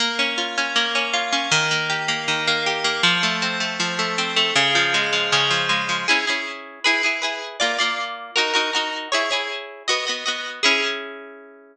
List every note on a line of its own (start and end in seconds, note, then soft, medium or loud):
0.00 0.75 A#3 loud
0.19 0.57 C#4 medium
0.38 1.13 F4 medium
0.58 0.94 C#4 medium
0.76 1.48 A#3 loud
0.95 1.32 C#4 medium
1.14 1.50 F4 medium
1.33 1.51 C#4 medium
1.51 2.27 D#3 loud
1.71 2.08 A#3 medium
1.90 2.66 G4 medium
2.08 2.47 A#3 loud
2.28 3.00 D#3 medium
2.47 2.84 A#3 medium
2.66 3.02 G4 medium
2.84 3.02 A#3 medium
3.03 3.79 F3 loud
3.23 3.60 A3 medium
3.42 4.18 C4 medium
3.60 3.98 A3 medium
3.80 4.52 F3 medium
3.99 4.36 A3 medium
4.18 4.54 C4 medium
4.36 4.54 A3 medium
4.56 5.32 C#3 loud
4.75 5.12 F3 medium
4.94 5.69 G#3 medium
5.13 5.50 F3 medium
5.32 6.04 C#3 loud
5.50 5.88 F3 medium
5.69 6.05 G#3 medium
5.89 6.07 F3 medium
6.08 6.25 C#4 medium
6.08 6.25 E4 medium
6.08 6.25 G#4 medium
6.27 6.80 C#4 medium
6.27 6.80 E4 medium
6.27 6.80 G#4 medium
6.84 7.02 E4 medium
6.84 7.02 G#4 medium
6.84 7.02 B4 medium
7.03 7.21 E4 medium
7.03 7.21 G#4 medium
7.03 7.21 B4 medium
7.22 7.57 E4 medium
7.22 7.57 G#4 medium
7.22 7.57 B4 medium
7.60 7.77 A#3 medium
7.60 7.77 F4 medium
7.60 7.77 D5 medium
7.79 8.31 A#3 medium
7.79 8.31 F4 medium
7.79 8.31 D5 medium
8.36 8.53 D#4 medium
8.36 8.53 F#4 medium
8.36 8.53 A#4 medium
8.54 8.71 D#4 medium
8.54 8.71 F#4 medium
8.54 8.71 A#4 medium
8.73 9.08 D#4 medium
8.73 9.08 F#4 medium
8.73 9.08 A#4 medium
9.12 9.29 E4 medium
9.12 9.29 G#4 medium
9.12 9.29 C#5 medium
9.31 9.83 E4 medium
9.31 9.83 G#4 medium
9.31 9.83 C#5 medium
9.88 10.05 B3 medium
9.88 10.05 F#4 medium
9.88 10.05 D#5 medium
10.07 10.24 B3 medium
10.07 10.24 F#4 medium
10.07 10.24 D#5 medium
10.26 10.61 B3 medium
10.26 10.61 F#4 medium
10.26 10.61 D#5 medium
10.63 11.77 C#4 loud
10.63 11.77 E4 medium
10.63 11.77 G#4 loud